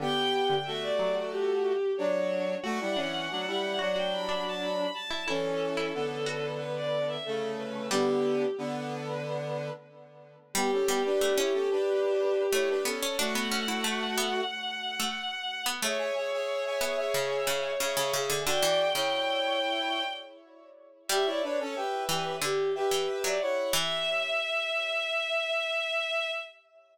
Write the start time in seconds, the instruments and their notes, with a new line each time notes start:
0.00 harpsichord D3, brass section B3 G4, violin G5
0.34 violin G5
0.50 harpsichord D3
0.64 brass section A3 F#4, violin E5
0.82 violin D5
0.99 harpsichord F#3
1.31 violin G4
1.97 brass section F#3 D4, violin C#5
2.63 brass section A3 F#4, harpsichord F#4, violin F#5
2.80 brass section G3 E4
2.96 brass section E3 C#4, harpsichord D4
3.30 brass section F#3 D4
3.47 brass section G3 E4
3.79 brass section F#3 D4, harpsichord F#4
3.96 harpsichord F#4, violin G5
4.12 violin B5
4.29 harpsichord D4
4.47 violin A5
4.61 violin B5
4.94 violin A5
5.11 harpsichord E4
5.26 brass section E3 C#4, harpsichord E4, violin A4
5.77 harpsichord E4
5.94 brass section D3 B3
6.26 harpsichord F#4
6.57 violin B4
6.76 violin D5
7.08 violin E5
7.24 brass section C#3 A3, violin A4
7.58 violin B4
7.91 brass section D3 B3, harpsichord G3, violin G4
8.58 brass section D3 B3
10.54 harpsichord G3, brass section B3 G4, violin G4
10.72 brass section C#4 A4
10.87 harpsichord G3, brass section B3 G4
11.05 brass section D4 B4
11.21 harpsichord A3
11.37 harpsichord C#4, brass section E4 C#5
11.53 brass section C#4 A4
11.71 brass section D4 B4
12.52 harpsichord A3, brass section E4 C#5
12.69 brass section D4 B4
12.85 harpsichord B3, brass section C#4 A4
13.02 harpsichord C#4
13.18 brass section A3 F#4, harpsichord D4, violin F#5
13.35 harpsichord B3
13.52 harpsichord C#4
13.68 harpsichord E4
13.84 harpsichord A3
14.18 harpsichord B3
15.00 harpsichord A3
15.66 harpsichord B3
15.82 harpsichord A3, brass section G#4 E5, violin C#5
15.99 brass section G#4 E5
16.15 brass section G#4 E5
16.32 brass section G#4 E5
16.65 brass section G#4 E5
16.81 harpsichord B3, brass section G#4 E5
16.97 brass section G#4 E5
17.14 harpsichord C#3
17.47 harpsichord C#3
17.80 harpsichord C#3, brass section G#4 E5
17.97 harpsichord C#3, brass section G#4 E5
18.13 harpsichord C#3, brass section G#4 E5
18.30 harpsichord D3
18.45 harpsichord D3, brass section F#4 D5, violin G5
18.63 harpsichord E3
18.95 harpsichord C#3, brass section E4 C#5
21.08 harpsichord G3, brass section G4 E5, violin E5
21.26 brass section E4 C#5, violin D5
21.43 brass section D4 B4, violin C#5
21.59 brass section C#4 A4
21.75 brass section G4 E5, violin B4
22.09 harpsichord E3, brass section G4 E5
22.41 harpsichord D3, violin G4
22.75 brass section G4 E5, violin B4
22.91 harpsichord E3
23.07 violin B4
23.24 harpsichord F#3, violin D5
23.40 brass section E4 C#5, violin F#5
23.73 harpsichord E3, violin E5, brass section E5